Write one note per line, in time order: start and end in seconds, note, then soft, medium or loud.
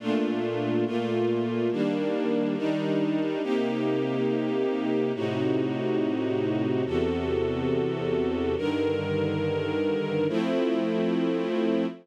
0.00 0.85 A#2 medium
0.00 0.85 A3 medium
0.00 0.85 D4 medium
0.00 0.85 F4 medium
0.86 1.71 A#2 medium
0.86 1.71 A3 medium
0.86 1.71 A#3 medium
0.86 1.71 F4 medium
1.71 2.56 D#3 medium
1.71 2.56 G3 medium
1.71 2.56 A#3 medium
1.71 2.56 D4 medium
2.57 3.42 D#3 medium
2.57 3.42 G3 medium
2.57 3.42 D4 medium
2.57 3.42 D#4 loud
3.43 5.12 C3 medium
3.43 5.12 A#3 medium
3.43 5.12 D#4 medium
3.43 5.12 G4 medium
5.14 6.84 A2 medium
5.14 6.84 C3 medium
5.14 6.84 D#4 medium
5.14 6.84 F#4 medium
6.86 8.55 E2 medium
6.86 8.55 C3 medium
6.86 8.55 F#4 medium
6.86 8.55 A4 medium
8.57 10.27 G2 medium
8.57 10.27 D3 medium
8.57 10.27 D#3 medium
8.57 10.27 A#4 medium
10.29 11.86 F3 loud
10.29 11.86 A3 loud
10.29 11.86 C4 medium
10.29 11.86 E4 loud